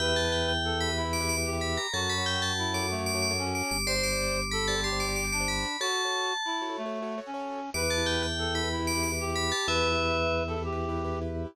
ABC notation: X:1
M:12/8
L:1/16
Q:3/8=124
K:Edor
V:1 name="Tubular Bells"
g2 a2 g2 g4 b2 z2 d'2 d'2 z2 b2 _b2 | a2 b2 g2 a4 d'2 z2 d'2 d'2 z2 d'2 d'2 | =c'2 d'6 b2 a2 c'2 d'2 d'2 d'2 b4 | a10 z14 |
d'2 a2 g2 g4 b2 z2 d'2 d'2 z2 b2 a2 | e10 z14 |]
V:2 name="Clarinet"
B8 A4 E6 G6 | F8 E4 A,6 C6 | =c8 A4 G6 D6 | F8 E4 A,6 C6 |
B8 A4 E6 G6 | B10 A2 G8 z4 |]
V:3 name="Acoustic Grand Piano"
[GBe] [GBe]2 [GBe]7 [GBe] [GBe]2 [GBe]2 [GBe]2 [GBe]2 [GBe]5 | [FAc] [FAc]2 [FAc]7 [FAc] [FAc]2 [FAc]2 [FAc]2 [FAc]2 [FAc]5 | [G=cd] [Gcd]2 [Gcd]7 [Gcd] [Gcd]2 [Gcd]2 [Gcd]2 [Gcd]2 [Gcd]5 | [FAc] [FAc]2 [FAc]7 [FAc] [FAc]2 [FAc]2 [FAc]2 [FAc]2 [FAc]5 |
[EGB] [EGB]2 [EGB]7 [EGB] [EGB]2 [EGB]2 [EGB]2 [EGB]2 [EGB]5 | [EGB] [EGB]2 [EGB]7 [EGB] [EGB]2 [EGB]2 [EGB]2 [EGB]2 [EGB]5 |]
V:4 name="Drawbar Organ" clef=bass
E,,24 | F,,22 G,,,2- | G,,,24 | z24 |
E,,24 | E,,24 |]